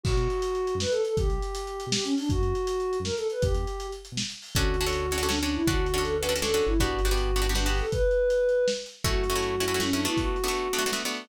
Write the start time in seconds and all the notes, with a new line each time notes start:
0.03 B1 F#4, kick, crash
0.12 B2
0.17 B2, closed hi-hat
0.30 closed hi-hat
0.42 closed hi-hat
0.55 closed hi-hat
0.67 closed hi-hat
0.75 F#2
0.80 B4, snare
0.90 A4, closed hi-hat
1.04 A4, closed hi-hat
1.17 B1 G4, kick, closed hi-hat
1.23 D2
1.28 B1, closed hi-hat
1.42 closed hi-hat
1.55 closed hi-hat
1.67 closed hi-hat
1.80 closed hi-hat
1.87 B2
1.92 G4, snare
2.04 C#4, closed hi-hat
2.17 D4, open hi-hat
2.29 F#2 F#4, kick, closed hi-hat
2.37 F#2
2.42 F#2, closed hi-hat
2.55 closed hi-hat
2.67 closed hi-hat
2.80 closed hi-hat
2.93 closed hi-hat
3.00 F#2
3.04 A#4, snare
3.16 A4, closed hi-hat
3.30 B4, closed hi-hat
3.41 E2 G4, kick, closed hi-hat
3.48 E2
3.54 E2, closed hi-hat
3.67 closed hi-hat
3.80 closed hi-hat
3.92 closed hi-hat
4.05 closed hi-hat
4.12 B2
4.17 snare
4.30 closed hi-hat
4.42 open hi-hat
4.55 D2 C#4 D4 F#4 A4, kick, closed hi-hat
4.74 closed hi-hat
4.81 C#4 D4 F#4 A4
4.86 C#4 D4 F#4 A4
4.93 closed hi-hat
5.11 C#4 D4 F#4 A4, closed hi-hat
5.18 C#4 D4 F#4 A4
5.23 C#4 D4 F#4 A4
5.28 C#4 D4 F#4 A4, snare
5.42 C#4 D4 F#4 A4
5.48 closed hi-hat
5.54 E4
5.67 D2 C#4 D4 F#4 A4, kick, closed hi-hat
5.86 closed hi-hat
5.94 C#4 D4 F#4 A4
5.98 C#4 D4 F#4 A4
6.03 A4, closed hi-hat
6.19 C#4 D4 F#4 A4 B4
6.24 closed hi-hat
6.29 C#4 D4 F#4 A4
6.36 C#4 D4 F#4 A4
6.42 C#4 D4 F#4 A4, snare
6.54 C#4 D4 F#4 A4
6.62 closed hi-hat
6.66 G1 E4
6.78 B3 D4 F#4 G4, kick, closed hi-hat
6.99 closed hi-hat
7.05 B3 D4 F#4 G4
7.11 B3 D4 F#4 G4
7.17 closed hi-hat
7.36 B3 D4 F#4 G4, closed hi-hat
7.42 B3 D4 F#4 G4
7.49 B3 D4 F#4 G4
7.55 B3 D4 F#4 G4, snare
7.66 B3 D4 F#4 G4
7.74 open hi-hat
7.79 A4
7.90 B4, kick, closed hi-hat
8.11 closed hi-hat
8.30 closed hi-hat
8.49 closed hi-hat
8.68 snare
8.86 closed hi-hat
9.04 F#2 A3 C#4 E4 F#4, kick, closed hi-hat
9.24 closed hi-hat
9.30 A3 C#4 E4 F#4
9.35 A3 C#4 E4 F#4
9.42 closed hi-hat
9.60 A3 C#4 E4 F#4, closed hi-hat
9.68 A3 C#4 E4 F#4
9.74 A3 C#4 E4 F#4
9.80 A3 C#4 E4 F#4, snare
9.91 A3 C#4 D4 E4 F#4
9.99 open hi-hat
10.05 A3 B3 D4 E4 F#4
10.17 F#4, kick, closed hi-hat
10.36 closed hi-hat
10.44 A3 B3 D4 F#4
10.48 A3 B3 D4 F#4
10.55 closed hi-hat
10.73 A3 B3 D4 F#4, closed hi-hat
10.78 A3 B3 D4 F#4
10.86 A3 B3 D4 F#4
10.92 A3 B3 D4 F#4, snare
11.05 A3 B3 D4 F#4
11.11 open hi-hat